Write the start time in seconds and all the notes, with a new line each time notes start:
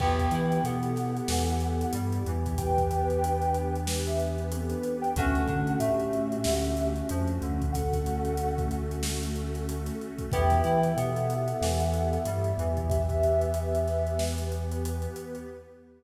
0.00 E2 B3 E4 G4 B4 G5, kick, crash
0.19 kick, closed hi-hat
0.31 E3 E4, closed hi-hat
0.52 closed hi-hat
0.64 B2 B3 A4 F#5, closed hi-hat
0.83 closed hi-hat
0.96 snare, closed hi-hat
1.17 closed hi-hat
1.28 E2 E3, snare
1.49 closed hi-hat
1.60 closed hi-hat
1.81 closed hi-hat
1.93 G2 G3, closed hi-hat
2.12 closed hi-hat
2.25 E2 E3, closed hi-hat
2.46 kick, closed hi-hat
2.58 B3 G4 B4 G5, kick, closed hi-hat
2.78 kick, closed hi-hat
2.91 closed hi-hat
3.10 closed hi-hat
3.22 D4, closed hi-hat
3.42 closed hi-hat
3.54 closed hi-hat
3.76 closed hi-hat
3.87 snare
4.06 G4 E5, closed hi-hat
4.20 closed hi-hat
4.38 closed hi-hat
4.51 B3 C4 A4, closed hi-hat
4.70 D4 B4, closed hi-hat
4.83 closed hi-hat
5.01 B4 G5, closed hi-hat
5.16 D2 A3 C#4 D4 F#4 A4 F#5, kick, closed hi-hat
5.35 closed hi-hat
5.47 D3 D4, kick, closed hi-hat
5.67 closed hi-hat
5.79 A2 A3 G4 E5, closed hi-hat
6.00 closed hi-hat
6.13 closed hi-hat
6.32 closed hi-hat
6.44 D2 D3, snare
6.64 closed hi-hat
6.77 closed hi-hat
6.96 closed hi-hat
7.09 F2 F3, closed hi-hat
7.28 closed hi-hat
7.42 D2 D3, closed hi-hat
7.62 kick, closed hi-hat
7.72 A3 C#4 F#4 A4 F#5, kick, closed hi-hat
7.93 kick, closed hi-hat
8.06 closed hi-hat
8.25 closed hi-hat
8.37 A4, closed hi-hat
8.58 kick, closed hi-hat
8.71 closed hi-hat
8.91 closed hi-hat
9.03 snare
9.23 closed hi-hat
9.36 closed hi-hat
9.54 snare, closed hi-hat
9.69 closed hi-hat
9.86 snare, closed hi-hat
10.01 closed hi-hat
10.18 kick, closed hi-hat
10.32 E2 B3 E4 G4 B4 E5 G5, kick, closed hi-hat
10.50 kick, snare, closed hi-hat
10.64 E3 E4, closed hi-hat
10.83 closed hi-hat
10.97 B2 B3 A4 F#5, closed hi-hat
11.16 closed hi-hat
11.30 closed hi-hat
11.48 closed hi-hat
11.61 E2 E3, snare
11.80 snare, closed hi-hat
11.94 closed hi-hat
12.13 closed hi-hat
12.25 G2 G3, closed hi-hat
12.44 closed hi-hat
12.58 E2 E3, closed hi-hat
12.77 kick, closed hi-hat
12.89 B3 G4 B4 E5, kick, closed hi-hat
13.09 kick, closed hi-hat
13.23 closed hi-hat
13.41 closed hi-hat
13.54 closed hi-hat
13.75 closed hi-hat
13.88 snare, closed hi-hat
14.07 closed hi-hat
14.19 snare
14.38 closed hi-hat
14.52 closed hi-hat
14.72 closed hi-hat
14.85 closed hi-hat
15.02 closed hi-hat
15.16 closed hi-hat
15.35 closed hi-hat